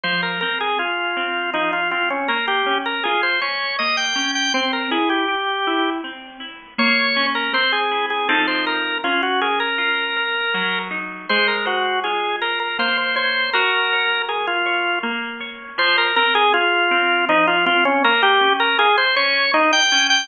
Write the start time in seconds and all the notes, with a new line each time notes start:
0.03 F3 C5
0.23 A#4
0.41 C4 A#4
0.60 G#4
0.79 F4 G#4
1.17 C4
1.53 F3 D#4
1.73 F4
1.91 C4 F4
2.10 C#4
2.28 A#3 A#4
2.48 G4
2.66 C#4
2.86 A#4
3.04 F4 G#4
3.23 C5
3.41 C#4 C#5
3.79 A#3 D#5
3.97 G5
4.15 C#4
4.35 G5
4.54 C4 C5
4.73 A#4
4.91 E4 G#4
5.10 G4
5.28 G4
5.67 E4
6.04 C4
6.40 E4
6.78 A#3 C#5
7.16 C#4
7.35 A#4
7.53 C4 C5
7.72 G#4
7.91 E4
8.10 G#4
8.29 F3 C4 D#4 A4
8.47 C5
8.67 A#4
9.04 C#4 F4
9.23 F#4
9.41 G#4 A#4
9.60 A#4
9.78 F4
10.17 A#4
10.54 F#3
10.91 D#4
11.29 G#3 C5
11.48 A#4
11.65 F#4 C5
12.04 F4 G#4
12.42 A#4 C5
12.60 A#4
12.79 A#3 C5
12.97 C5
13.16 C5 C#5
13.53 F#4 A#4
13.93 C#5
14.28 G#4 A#4
14.47 F4
14.66 C#5
15.03 A#3
15.40 C#5
15.78 F3 C5
15.98 A#4
16.16 C4 A#4
16.35 G#4
16.54 F4 G#4
16.91 C4
17.29 F3 D#4
17.47 F4
17.66 C4 F4
17.85 C#4
18.04 A#3 A#4
18.23 G4
18.41 C#4
18.60 A#4
18.78 F4 G#4
18.98 C5
19.16 C#4 C#5
19.53 A#3 D#4
19.73 G5
19.92 C#4
20.10 G5